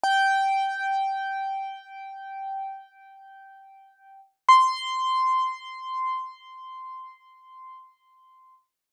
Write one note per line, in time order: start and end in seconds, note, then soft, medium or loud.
0.03 4.20 G5 medium
4.49 8.54 C6 medium